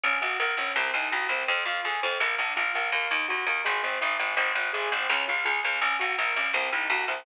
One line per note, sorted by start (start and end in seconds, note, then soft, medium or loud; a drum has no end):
0.04 0.19 A#1 medium
0.04 0.20 C#4 medium
0.04 kick loud
0.04 snare medium
0.13 snare medium
0.21 0.37 A#1 medium
0.21 0.37 F#4 medium
0.21 snare medium
0.30 snare medium
0.39 0.55 A#1 medium
0.39 0.56 A#4 medium
0.39 snare medium
0.49 snare medium
0.57 0.73 A#1 medium
0.57 0.75 C#4 medium
0.57 snare medium
0.67 snare medium
0.76 0.91 C2 medium
0.76 0.92 C4 medium
0.76 snare loud
0.84 snare medium
0.94 1.09 C2 medium
0.94 1.11 D#4 medium
0.94 snare medium
1.02 snare medium
1.11 1.27 C2 medium
1.11 1.27 F#4 medium
1.11 snare medium
1.21 snare medium
1.29 1.44 C2 medium
1.29 1.46 C4 medium
1.29 snare medium
1.39 snare medium
1.48 1.64 F2 medium
1.48 1.64 C4 loud
1.48 kick loud
1.48 snare medium
1.57 snare medium
1.65 1.81 F2 medium
1.65 1.82 F4 medium
1.65 snare medium
1.76 snare medium
1.84 2.00 F2 medium
1.84 2.01 G#4 medium
1.84 snare medium
1.94 snare medium
2.03 2.18 F2 medium
2.03 2.19 C4 medium
2.03 snare medium
2.11 snare medium
2.20 2.36 A#1 medium
2.20 2.36 A#3 medium
2.20 snare loud
2.29 snare medium
2.38 2.54 A#1 medium
2.38 2.55 D4 medium
2.38 snare medium
2.48 snare medium
2.56 2.72 A#1 medium
2.56 2.73 F4 medium
2.56 snare medium
2.65 snare medium
2.74 2.91 A#1 medium
2.74 2.91 A#3 medium
2.74 snare medium
2.84 snare medium
2.92 3.08 D#2 medium
2.92 3.09 A#3 medium
2.92 kick medium
2.92 snare medium
3.02 snare medium
3.11 3.26 D#2 medium
3.11 3.28 D#4 medium
3.11 snare medium
3.20 snare medium
3.28 3.45 D#2 medium
3.28 3.45 F#4 medium
3.28 snare medium
3.38 snare medium
3.47 3.62 D#2 medium
3.47 3.63 A#3 medium
3.47 snare medium
3.56 snare medium
3.65 3.81 G#1 medium
3.65 3.81 G#3 medium
3.65 snare loud
3.74 snare medium
3.83 3.99 G#1 medium
3.83 3.99 C4 medium
3.83 snare medium
3.92 snare medium
4.01 4.17 G#1 medium
4.01 4.17 D#4 medium
4.01 snare medium
4.11 snare medium
4.19 4.35 G#1 medium
4.19 4.35 G#3 medium
4.19 snare medium
4.28 snare medium
4.37 4.52 G#1 medium
4.37 4.53 C4 loud
4.37 kick loud
4.37 snare medium
4.37 crash loud
4.47 snare medium
4.55 4.71 G#1 medium
4.55 4.71 D#4 medium
4.55 snare loud
4.65 snare medium
4.73 4.89 G#1 medium
4.73 4.89 G#4 medium
4.73 snare medium
4.83 snare medium
4.91 5.07 G#1 medium
4.91 5.07 C4 medium
4.91 snare medium
5.01 snare medium
5.09 5.25 C#2 medium
5.09 5.26 C#4 loud
5.09 snare loud
5.18 snare medium
5.28 5.44 C#2 medium
5.28 5.44 F4 medium
5.28 snare medium
5.37 snare medium
5.45 5.61 C#2 medium
5.45 5.61 G#4 medium
5.45 snare medium
5.55 snare medium
5.63 5.80 C#2 medium
5.63 5.80 C#4 medium
5.63 snare medium
5.73 snare medium
5.81 5.97 A#1 medium
5.81 5.99 C#4 loud
5.81 kick loud
5.81 snare medium
5.91 snare medium
5.99 6.16 A#1 medium
5.99 6.16 F#4 medium
5.99 snare medium
6.09 snare medium
6.18 6.34 A#1 medium
6.18 6.34 A#4 medium
6.18 snare medium
6.27 snare medium
6.36 6.52 A#1 medium
6.36 6.52 C#4 medium
6.36 snare loud
6.45 snare medium
6.53 6.69 C2 medium
6.53 6.70 C4 loud
6.53 snare loud
6.63 snare medium
6.72 6.88 C2 medium
6.72 6.89 D#4 medium
6.72 snare loud
6.81 snare medium
6.90 7.05 C2 medium
6.90 7.07 F#4 medium
6.90 snare loud
7.00 snare medium
7.08 7.23 C2 medium
7.08 7.25 C4 medium
7.08 snare medium
7.17 snare medium